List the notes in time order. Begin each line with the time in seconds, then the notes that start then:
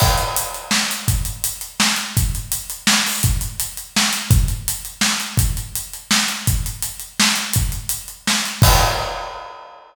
0.00 kick, crash
0.18 closed hi-hat
0.36 closed hi-hat
0.54 closed hi-hat
0.71 snare
0.91 closed hi-hat
1.08 kick, closed hi-hat
1.25 closed hi-hat
1.44 closed hi-hat
1.61 closed hi-hat
1.80 snare
1.96 closed hi-hat
2.17 kick, closed hi-hat
2.35 closed hi-hat
2.52 closed hi-hat
2.70 closed hi-hat
2.87 snare
3.06 open hi-hat
3.23 kick, closed hi-hat
3.41 closed hi-hat
3.60 closed hi-hat
3.77 closed hi-hat
3.96 snare
4.13 closed hi-hat
4.31 kick, closed hi-hat
4.48 closed hi-hat
4.68 closed hi-hat
4.85 closed hi-hat
5.01 snare
5.20 closed hi-hat
5.37 kick, closed hi-hat
5.57 closed hi-hat
5.75 closed hi-hat
5.93 closed hi-hat
6.11 snare
6.28 closed hi-hat
6.47 kick, closed hi-hat
6.66 closed hi-hat
6.82 closed hi-hat
7.00 closed hi-hat
7.20 snare
7.36 closed hi-hat
7.53 kick, closed hi-hat
7.72 closed hi-hat
7.89 closed hi-hat
8.08 closed hi-hat
8.27 snare
8.45 closed hi-hat
8.62 kick, crash